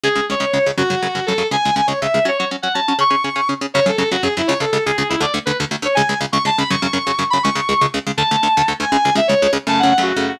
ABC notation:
X:1
M:6/8
L:1/16
Q:3/8=162
K:F#m
V:1 name="Distortion Guitar"
G4 c6 z2 | F8 A4 | g4 g2 c2 e4 | c2 c2 z2 f2 a4 |
c'8 z4 | c2 A2 A2 F2 G2 E2 | c2 A2 A2 G2 G2 E2 | d2 z2 B2 z4 c2 |
g4 z2 c'2 a2 b2 | c'10 b2 | c'8 z4 | a10 g2 |
g4 e2 c4 z2 | a2 f2 f2 F4 F2 |]
V:2 name="Overdriven Guitar"
[C,,C,G,]2 [C,,C,G,]2 [C,,C,G,]2 [C,,C,G,]2 [C,,C,G,]2 [C,,C,G,]2 | [F,,C,F,]2 [F,,C,F,]2 [F,,C,F,]2 [F,,C,F,]2 [F,,C,F,]2 [F,,C,F,]2 | [C,,C,G,]2 [C,,C,G,]2 [C,,C,G,]2 [C,,C,G,]2 [C,,C,G,]2 [C,,C,G,]2 | [F,CF]2 [F,CF]2 [F,CF]2 [F,CF]2 [F,CF]2 [F,CF]2 |
[C,CG]2 [C,CG]2 [C,CG]2 [C,CG]2 [C,CG]2 [C,CG]2 | [F,,C,F,]2 [F,,C,F,]2 [F,,C,F,]2 [F,,C,F,]2 [F,,C,F,]2 [F,,C,F,]2 | [C,,C,G,]2 [C,,C,G,]2 [C,,C,G,]2 [C,,C,G,]2 [C,,C,G,]2 [C,,C,G,]2 | [D,,D,A,]2 [D,,D,A,]2 [D,,D,A,]2 [D,,D,A,]2 [D,,D,A,]2 [D,,D,A,]2 |
[C,,C,G,]2 [C,,C,G,]2 [C,,C,G,]2 [C,,C,G,]2 [C,,C,G,]2 [C,,C,G,]2 | [F,,C,F,]2 [F,,C,F,]2 [F,,C,F,]2 [F,,C,F,]2 [F,,C,F,]2 [F,,C,F,]2 | [C,,C,G,]2 [C,,C,G,]2 [C,,C,G,]2 [C,,C,G,]2 [C,,C,G,]2 [C,,C,G,]2 | [D,,D,A,]2 [D,,D,A,]2 [D,,D,A,]2 [D,,D,A,]2 [D,,D,A,]2 [D,,D,A,]2 |
[C,,C,G,]2 [C,,C,G,]2 [C,,C,G,]2 [C,,C,G,]2 [C,,C,G,]2 [C,,C,G,]2 | [F,,C,A,]3 [F,,C,A,]2 [F,,C,A,]3 [F,,C,A,]4 |]